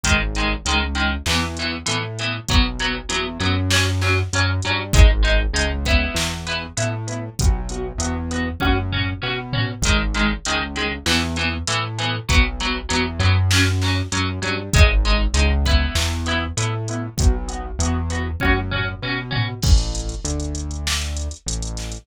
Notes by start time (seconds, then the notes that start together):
0.03 G#1 D#3 G#3, kick, closed hi-hat
0.35 D#3 G#3, closed hi-hat
0.65 C#2 D#3 G#3, closed hi-hat
0.95 D#3 G#3, closed hi-hat
1.26 E2 E3 B3, snare
1.57 E3 B3, closed hi-hat
1.86 A2 E3 B3, closed hi-hat
2.19 E3 B3, closed hi-hat
2.48 B1 F#3 B3, kick, closed hi-hat
2.79 F#3 B3, closed hi-hat
3.09 E2 F#3 B3, closed hi-hat
3.40 F#2 F#3 B3, closed hi-hat
3.71 F#3 C#4, snare
4.01 F#3 C#4, snare
4.33 F#2 F#3 C#4, closed hi-hat
4.62 G2 F#3 C#4, closed hi-hat
4.93 G#1 G#3 D#4, kick, closed hi-hat
5.23 G#3 D#4, closed hi-hat
5.53 C#2 G#3 D#4, closed hi-hat
5.85 B3 E4, kick, closed hi-hat
6.15 E2, snare
6.47 B3 E4, closed hi-hat
6.77 A2 B3 E4, closed hi-hat
7.07 B3 E4, closed hi-hat
7.39 B1 B3 F#4, kick, closed hi-hat
7.69 B3 F#4, closed hi-hat
7.98 E2 B3 F#4, closed hi-hat
8.31 B3 F#4, closed hi-hat
8.60 F#2 C#4 F#4, kick, high tom
8.92 C#4 F#4, floor tom
9.22 B2 C#4 F#4
9.53 C#4 F#4, floor tom
9.82 G#1 D#3, kick, closed hi-hat
9.87 G#3
10.14 D#3 G#3, closed hi-hat
10.45 C#2 D#3 G#3, closed hi-hat
10.76 D#3 G#3, closed hi-hat
11.06 E2 E3 B3, snare
11.36 E3 B3, closed hi-hat
11.67 A2 E3 B3, closed hi-hat
11.98 E3 B3, closed hi-hat
12.29 B1 F#3 B3, kick, closed hi-hat
12.60 F#3 B3, closed hi-hat
12.89 E2 F#3 B3, closed hi-hat
13.19 F#2 F#3 B3, closed hi-hat
13.51 F#3 C#4, snare
13.82 F#3 C#4, snare
14.12 F#2 F#3 C#4, closed hi-hat
14.42 G2 F#3 C#4, closed hi-hat
14.73 G#1 G#3 D#4, kick, closed hi-hat
15.05 G#3 D#4, closed hi-hat
15.34 C#2 G#3 D#4, closed hi-hat
15.65 B3 E4, kick, closed hi-hat
15.95 E2, snare
16.26 B3 E4, closed hi-hat
16.57 A2 B3 E4, closed hi-hat
16.88 B3 E4, closed hi-hat
17.17 B1 B3 F#4, kick, closed hi-hat
17.48 B3 F#4, closed hi-hat
17.79 E2 B3, closed hi-hat
17.83 F#4
18.10 B3 F#4, closed hi-hat
18.40 F#2 C#4 F#4, kick, high tom
18.71 C#4 F#4, floor tom
19.02 B2 C#4 F#4
19.31 C#4 F#4, floor tom
19.62 A1, kick, crash
19.78 closed hi-hat
19.95 closed hi-hat
20.09 closed hi-hat
20.24 D2, closed hi-hat
20.40 closed hi-hat
20.55 closed hi-hat
20.71 closed hi-hat
20.87 snare
21.02 closed hi-hat
21.17 closed hi-hat
21.31 closed hi-hat
21.46 A1, closed hi-hat
21.62 closed hi-hat
21.77 snare, closed hi-hat
21.92 closed hi-hat